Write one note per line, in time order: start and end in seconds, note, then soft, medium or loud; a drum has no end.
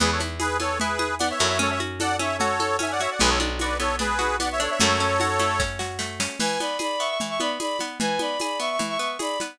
0.00 1.32 E2 medium
0.00 0.59 B3 loud
0.00 0.11 G#4 medium
0.00 0.11 B4 loud
0.00 low conga loud
0.00 shaker medium
0.12 0.21 A4 medium
0.12 0.21 C#5 medium
0.20 0.80 E4 medium
0.20 high conga medium
0.20 shaker medium
0.40 0.99 G#4 medium
0.40 0.57 G#4 medium
0.40 0.57 B4 medium
0.40 tambourine medium
0.40 high conga loud
0.40 shaker medium
0.60 1.20 B3 medium
0.60 0.78 A4 medium
0.60 0.78 C#5 medium
0.60 high conga medium
0.60 shaker medium
0.80 1.40 E4 medium
0.80 1.15 G#4 medium
0.80 1.15 B4 medium
0.80 low conga loud
0.80 shaker medium
0.99 1.56 G#4 medium
0.99 high conga medium
0.99 shaker medium
1.19 1.58 B3 medium
1.19 1.29 D5 medium
1.19 1.29 F#5 medium
1.19 tambourine medium
1.19 high conga medium
1.19 shaker medium
1.30 1.39 C#5 medium
1.30 1.40 E5 medium
1.39 3.07 F#2 medium
1.39 1.59 E4 medium
1.39 1.49 A4 medium
1.39 1.48 C#5 medium
1.39 snare medium
1.39 shaker medium
1.48 1.58 C#5 medium
1.48 1.58 E5 medium
1.59 2.19 C#4 loud
1.59 1.71 A4 medium
1.59 1.70 C#5 medium
1.59 low conga medium
1.59 shaker medium
1.70 1.80 C#5 medium
1.70 1.80 E5 medium
1.80 2.40 F#4 medium
1.80 high conga medium
1.80 shaker medium
2.00 2.60 A4 medium
2.00 2.17 D5 medium
2.00 2.17 F#5 loud
2.00 tambourine medium
2.00 high conga loud
2.00 shaker loud
2.19 2.78 C#4 medium
2.19 2.37 C#5 medium
2.19 2.37 E5 medium
2.19 high conga medium
2.19 shaker medium
2.39 3.00 F#4 medium
2.39 2.77 A4 medium
2.39 2.77 C#5 medium
2.39 low conga medium
2.39 shaker medium
2.60 3.17 A4 medium
2.60 high conga medium
2.60 shaker medium
2.79 3.17 C#4 medium
2.79 2.91 E5 medium
2.79 2.91 G#5 medium
2.79 tambourine medium
2.79 high conga loud
2.79 shaker medium
2.91 3.01 D5 medium
2.91 3.01 F#5 medium
3.00 3.20 F#4 medium
3.00 3.10 C#5 medium
3.00 3.10 E5 medium
3.00 snare medium
3.00 shaker medium
3.11 3.20 D5 medium
3.11 3.20 F#5 medium
3.20 4.68 B1 medium
3.20 3.79 B3 loud
3.20 3.30 G#4 loud
3.20 3.30 B4 loud
3.20 low conga loud
3.20 shaker medium
3.29 3.39 A4 medium
3.29 3.39 C#5 medium
3.40 3.99 D4 medium
3.40 high conga medium
3.40 shaker medium
3.59 4.18 F#4 medium
3.59 3.78 B4 medium
3.59 3.78 D5 medium
3.59 tambourine medium
3.59 high conga medium
3.59 shaker medium
3.79 4.39 B3 medium
3.79 3.96 A4 medium
3.79 3.96 C#5 medium
3.79 high conga medium
3.79 shaker medium
3.99 4.59 D4 medium
3.99 4.36 G#4 medium
3.99 4.36 B4 loud
3.99 low conga medium
3.99 shaker medium
4.19 4.76 F#4 medium
4.19 high conga medium
4.19 shaker medium
4.39 4.78 B3 medium
4.39 4.49 D5 medium
4.39 4.49 F#5 medium
4.39 tambourine medium
4.39 high conga medium
4.39 shaker medium
4.52 4.61 C#5 medium
4.52 4.62 E5 medium
4.60 4.79 D4 loud
4.60 4.71 A4 medium
4.60 4.70 C#5 medium
4.60 snare medium
4.60 shaker medium
4.71 4.79 C#5 medium
4.71 4.80 E5 medium
4.80 6.28 F#2 loud
4.80 5.39 A3 loud
4.80 5.62 A4 medium
4.80 5.62 C#5 loud
4.80 low conga loud
4.80 shaker medium
4.99 5.59 C#4 medium
4.99 shaker medium
5.20 5.79 F#4 medium
5.20 tambourine medium
5.20 high conga medium
5.20 shaker medium
5.39 5.98 A3 medium
5.39 high conga medium
5.39 shaker medium
5.60 6.20 C#4 medium
5.60 kick medium
5.60 snare medium
5.79 6.36 F#4 medium
5.79 snare medium
5.99 6.37 A3 medium
5.99 snare medium
6.20 6.39 C#4 medium
6.20 snare loud
6.40 6.58 E3 medium
6.40 6.59 B4 medium
6.40 6.59 G#5 medium
6.40 crash loud
6.40 low conga loud
6.40 shaker medium
6.60 6.78 B3 medium
6.60 6.76 D5 medium
6.60 6.76 B5 medium
6.60 high conga medium
6.60 shaker medium
6.79 6.97 G#4 medium
6.79 7.00 D5 medium
6.79 7.00 B5 medium
6.79 tambourine medium
6.79 high conga medium
6.79 shaker medium
6.99 7.18 B3 medium
6.99 7.08 E5 medium
6.99 7.08 C#6 medium
6.99 shaker medium
7.09 7.19 E5 medium
7.09 7.19 C#6 medium
7.20 7.39 E3 medium
7.20 low conga medium
7.20 shaker medium
7.29 7.39 E5 medium
7.29 7.39 C#6 medium
7.40 7.58 B3 medium
7.40 7.50 D5 medium
7.40 7.50 B5 medium
7.40 high conga medium
7.40 shaker medium
7.60 7.78 G#4 medium
7.60 7.77 D5 medium
7.60 7.77 B5 medium
7.60 tambourine medium
7.60 high conga medium
7.60 shaker medium
7.79 7.99 B3 medium
7.79 snare medium
7.79 high conga medium
7.79 shaker medium
7.99 8.18 E3 medium
7.99 8.19 B4 medium
7.99 8.19 G#5 loud
7.99 low conga loud
7.99 shaker medium
8.19 8.37 B3 medium
8.19 8.38 D5 medium
8.19 8.38 B5 medium
8.19 high conga medium
8.19 shaker medium
8.40 8.59 G#4 medium
8.40 8.59 D5 medium
8.40 8.59 B5 medium
8.40 tambourine medium
8.40 high conga medium
8.40 shaker medium
8.60 8.78 B3 medium
8.60 8.69 E5 medium
8.60 8.69 C#6 medium
8.60 shaker medium
8.71 8.80 E5 medium
8.71 8.80 C#6 medium
8.79 8.97 E3 medium
8.79 low conga medium
8.79 shaker medium
8.89 8.98 E5 medium
8.89 8.98 C#6 medium
8.99 9.17 B3 medium
8.99 9.09 E5 medium
8.99 9.09 C#6 medium
8.99 shaker medium
9.19 9.37 G#4 medium
9.19 9.38 D5 medium
9.19 9.38 B5 medium
9.19 tambourine medium
9.19 high conga medium
9.19 shaker medium
9.40 9.59 B3 medium
9.40 snare medium
9.40 high conga medium
9.40 shaker medium